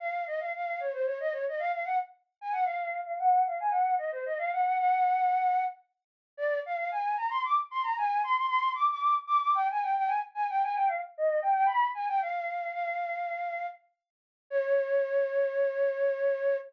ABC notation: X:1
M:3/4
L:1/16
Q:1/4=113
K:Db
V:1 name="Flute"
f2 e f f2 d c d e d e | f f g z3 a g f3 f | g2 f a g2 e c e f g g | g8 z4 |
[K:Eb] d2 f f a2 b c' d' z c' b | a2 c' c' c'2 d' d' d' z d' d' | g a g g a z a g a g f z | e2 g g _c'2 a g f4 |
[K:Db] "^rit." f8 z4 | d12 |]